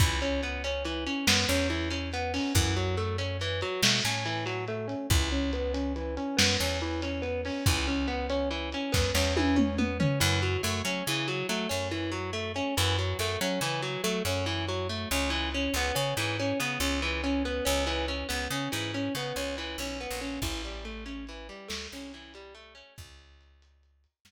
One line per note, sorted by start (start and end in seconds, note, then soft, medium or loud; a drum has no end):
0.00 1.08 C#2 medium
0.00 0.20 E3 medium
0.00 kick loud
0.00 closed hi-hat medium
0.21 0.41 C#4 medium
0.21 closed hi-hat medium
0.43 0.62 B3 medium
0.43 closed hi-hat medium
0.64 0.83 C#4 medium
0.64 closed hi-hat medium
0.85 1.04 E3 medium
0.85 closed hi-hat medium
1.07 1.26 C#4 soft
1.07 closed hi-hat medium
1.27 1.45 F#2 medium
1.27 1.46 B3 medium
1.27 snare loud
1.49 2.39 E2 medium
1.49 1.68 C#4 medium
1.49 closed hi-hat medium
1.70 1.89 E3 medium
1.70 closed hi-hat medium
1.90 2.10 C#4 medium
1.90 closed hi-hat medium
2.13 2.33 B3 medium
2.13 closed hi-hat medium
2.34 2.53 C#4 medium
2.34 open hi-hat medium
2.55 3.63 F#2 loud
2.55 2.74 E3 medium
2.55 kick medium
2.55 closed hi-hat medium
2.76 2.96 F#3 medium
2.76 closed hi-hat medium
2.97 3.16 A3 medium
2.97 closed hi-hat medium
3.18 3.38 C#4 medium
3.18 closed hi-hat medium
3.41 3.60 E3 medium
3.41 closed hi-hat medium
3.61 3.81 F#3 medium
3.61 closed hi-hat medium
3.82 4.01 B2 medium
3.82 4.03 A3 medium
3.82 snare loud
4.04 4.95 A2 medium
4.04 4.24 C#4 medium
4.04 closed hi-hat medium
4.26 4.45 E3 medium
4.26 closed hi-hat medium
4.46 4.65 F#3 medium
4.46 closed hi-hat medium
4.68 4.87 A3 medium
4.68 closed hi-hat medium
4.88 5.07 C#4 medium
4.88 closed hi-hat medium
5.10 6.19 C#2 medium
5.10 5.30 E3 medium
5.10 kick medium
5.10 closed hi-hat medium
5.32 5.51 C#4 medium
5.32 closed hi-hat medium
5.53 5.72 B3 medium
5.53 closed hi-hat medium
5.74 5.93 C#4 medium
5.74 closed hi-hat medium
5.96 6.15 E3 medium
5.96 closed hi-hat medium
6.17 6.36 C#4 medium
6.17 closed hi-hat medium
6.37 6.57 F#2 medium
6.37 6.56 B3 medium
6.37 snare loud
6.60 7.51 E2 medium
6.60 6.79 C#4 medium
6.60 closed hi-hat medium
6.81 7.01 E3 medium
6.81 closed hi-hat medium
7.02 7.22 C#4 medium
7.02 closed hi-hat loud
7.22 7.41 B3 medium
7.22 closed hi-hat medium
7.45 7.65 C#4 medium
7.45 open hi-hat medium
7.66 8.75 C#2 medium
7.66 7.87 E3 medium
7.66 kick loud
7.66 closed hi-hat medium
7.87 8.07 C#4 medium
7.87 closed hi-hat medium
8.08 8.27 B3 medium
8.08 closed hi-hat medium
8.30 8.49 C#4 medium
8.30 closed hi-hat medium
8.51 8.70 E3 medium
8.51 closed hi-hat medium
8.72 8.93 C#4 medium
8.72 closed hi-hat medium
8.92 9.12 F#2 medium
8.92 9.11 B3 medium
8.92 kick medium
8.92 snare medium
9.15 10.05 E2 medium
9.15 9.34 C#4 medium
9.15 snare medium
9.37 9.56 E3 medium
9.37 high tom medium
9.56 9.75 C#4 medium
9.56 mid tom medium
9.78 9.98 B3 medium
9.78 mid tom medium
10.00 10.19 C#4 medium
10.00 floor tom loud
10.20 10.57 F#2 loud
10.20 10.39 E3 loud
10.42 10.62 F#3 medium
10.63 10.82 F#2 medium
10.63 10.82 A3 medium
10.85 11.03 F#3 medium
10.85 11.04 C#4 medium
11.07 11.43 C#3 medium
11.07 11.27 E3 loud
11.28 11.47 F#3 medium
11.49 11.67 F#3 medium
11.49 11.68 A3 medium
11.69 12.61 F#2 medium
11.69 11.88 C#4 medium
11.91 12.11 E3 medium
12.12 12.31 F#3 medium
12.33 12.52 A3 medium
12.56 12.75 C#4 medium
12.77 13.14 F#2 medium
12.77 12.96 E3 loud
12.98 13.18 F#3 medium
13.19 13.37 F#2 medium
13.19 13.39 A3 medium
13.41 13.59 F#3 medium
13.41 13.60 C#4 medium
13.61 13.97 C#3 medium
13.61 13.81 E3 loud
13.82 14.02 F#3 medium
14.04 14.22 F#3 medium
14.04 14.23 A3 medium
14.25 15.06 F#2 medium
14.25 14.45 C#4 medium
14.46 14.65 E3 loud
14.68 14.88 F#3 medium
14.89 15.09 A3 medium
15.11 15.68 C#2 medium
15.11 15.30 C#4 medium
15.30 15.49 E3 medium
15.54 15.74 C#4 medium
15.74 15.92 C#2 medium
15.74 15.95 B3 loud
15.95 16.14 C#3 medium
15.95 16.14 C#4 medium
16.17 16.53 G#2 medium
16.17 16.37 E3 medium
16.40 16.59 C#4 medium
16.60 16.78 C#3 medium
16.60 16.79 B3 medium
16.80 17.61 C#2 medium
16.80 17.00 C#4 medium
17.02 17.21 E3 medium
17.24 17.43 C#4 medium
17.45 17.64 B3 medium
17.65 18.24 C#2 medium
17.65 17.84 C#4 medium
17.87 18.06 E3 loud
18.08 18.27 C#4 medium
18.29 18.48 C#2 medium
18.29 18.48 B3 medium
18.50 18.69 C#3 medium
18.50 18.71 C#4 medium
18.72 19.09 G#2 medium
18.72 18.91 E3 medium
18.94 19.13 C#4 medium
19.15 19.33 C#3 medium
19.15 19.36 B3 medium
19.36 19.76 C#2 medium
19.36 19.56 C#4 medium
19.58 19.77 E3 medium
19.78 20.07 B1 medium
19.78 19.99 C#4 medium
20.01 20.20 B3 medium
20.11 20.39 A#1 medium
20.21 20.40 C#4 medium
20.42 21.50 A1 medium
20.42 20.62 E3 medium
20.42 kick medium
20.42 crash medium
20.64 20.84 G3 medium
20.64 closed hi-hat medium
20.85 21.04 A3 medium
20.85 closed hi-hat medium
21.06 21.25 C#4 medium
21.06 closed hi-hat medium
21.27 21.48 E3 medium
21.27 closed hi-hat medium
21.49 21.68 G3 medium
21.49 closed hi-hat medium
21.68 21.88 D2 medium
21.68 21.88 A3 medium
21.68 snare medium
21.91 22.83 C2 medium
21.91 22.12 C#4 medium
21.91 closed hi-hat medium
22.13 22.33 E3 medium
22.13 closed hi-hat medium
22.34 22.54 G3 medium
22.34 closed hi-hat medium
22.55 22.74 A3 medium
22.55 closed hi-hat medium
22.75 22.94 C#4 medium
22.75 closed hi-hat medium
22.98 24.06 C#2 medium
22.98 kick medium
22.98 closed hi-hat medium
23.19 closed hi-hat medium
23.41 closed hi-hat medium
23.62 closed hi-hat medium
23.83 closed hi-hat medium
24.04 closed hi-hat medium
24.25 24.31 F#2 medium
24.25 snare medium